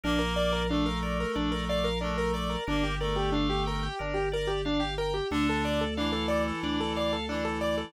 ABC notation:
X:1
M:4/4
L:1/16
Q:1/4=91
K:Dm
V:1 name="Acoustic Grand Piano"
D B d B D B d B D B d B D B d B | D G B G D G B G D G B G D G B G | D A d A D A d A D A d A D A d A |]
V:2 name="Clarinet"
[B,B]4 [A,A]8 [A,A]4 | [B,B]2 [A,A]6 z8 | [D,D]4 [E,E]8 [E,E]4 |]
V:3 name="Drawbar Organ"
B2 d2 f2 B2 d2 f2 B2 d2 | B2 d2 f2 g2 B2 d2 f2 g2 | A2 d2 f2 A2 d2 f2 A2 d2 |]
V:4 name="Drawbar Organ" clef=bass
B,,,8 B,,,8 | G,,,8 G,,,8 | D,,8 D,,8 |]